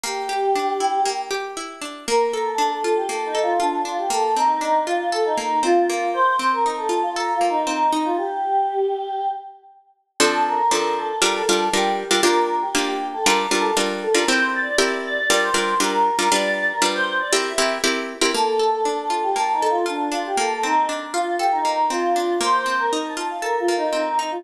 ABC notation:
X:1
M:4/4
L:1/16
Q:1/4=118
K:Bb
V:1 name="Choir Aahs"
G10 z6 | B3 A2 A2 G (3A2 E2 F2 D2 F G | A2 E4 F2 A E3 F4 | c3 B2 A2 F (3b2 F2 E2 E2 E F |
G10 z6 | [K:F] A2 B4 A2 B A3 G4 | B3 G2 G2 A (3B2 B2 A2 z2 A B | c2 d4 d2 d c3 B4 |
d3 B2 c2 d e4 z4 | [K:Bb] A3 A2 A2 G (3a2 E2 F2 D2 F G | A2 E2 z2 F2 G E3 F4 | c3 B2 a2 f (3B2 F2 E2 E2 E F |]
V:2 name="Acoustic Guitar (steel)"
B,2 G2 D2 =E2 B,2 G2 E2 D2 | B,2 A2 D2 F2 B,2 A2 F2 D2 | B,2 C2 D2 F2 A2 B,2 C2 B,2- | B,2 C2 E2 F2 A2 B,2 C2 E2 |
z16 | [K:F] [F,CDA]4 [F,CDA]4 [G,DFB]2 [G,DFB]2 [G,DFB]3 [G,DFB] | [B,DFG]4 [B,DFG]4 [G,DFB]2 [G,DFB]2 [G,DFB]3 [G,DFB] | [CEGB]4 [CEGB]4 [G,DFB]2 [G,DFB]2 [G,DFB]3 [G,DFB] |
[G,DF=B]4 [G,DFB]4 [CEG_B]2 [CEGB]2 [CEGB]3 [CEGB] | [K:Bb] B,2 A2 D2 F2 B,2 A2 F2 D2 | B,2 C2 D2 F2 A2 B,2 C2 D2 | B,2 C2 E2 F2 A2 B,2 C2 E2 |]